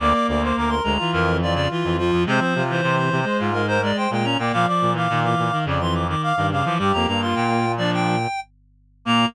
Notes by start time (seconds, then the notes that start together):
0.00 D2 A#3 D5 D6
0.14 D6
0.28 D2 D5 D6
0.42 C5 D6
0.57 D2 A#4 D6
0.69 A#4 C6
0.84 D2 G#3 A#5
0.97 E3 F4
1.13 F2 A#4
1.41 E3 F4 D5
1.54 C#3 D5
1.71 E3 F4
1.84 F2 E3
1.98 F3 F4
2.12 F2
2.26 C3 G#3 C4 C5
2.39 F3 C5
2.55 C3 F4
2.70 E3 C5
2.83 C3 C5
2.97 C5
3.12 C3
3.24 G#3 C5
3.39 G#2 F4
3.53 G#3 A#4
3.68 A#4 C5
3.83 G#3 D5
3.97 C5 G5
4.10 A#2 G#3 G5
4.24 C#4 A#5
4.38 A#2 A#3 D5 G5
4.52 A#2 F3 F5 D6
4.66 F3 D5 D6
4.81 A#2
4.93 E3 F5 D6
5.09 A#2 D#3
5.23 E3 D6
5.38 A#2
5.52 D#3
5.64 F2 C#3 D5
5.81 E3 C6
5.94 D6
6.09 D#3 D6
6.22 F5 D6
6.36 G2 D#3 D6
6.51 C#3 F5 D6
6.65 E3 F3 D6
6.78 G2 G3 G4 D6
6.93 F2 A#3 A#5
7.07 G2 A#3 A#5
7.21 F4 C6
7.35 A#2 G5
7.77 F3 D4 D5
7.94 G5
9.05 A#2 A#3 A#5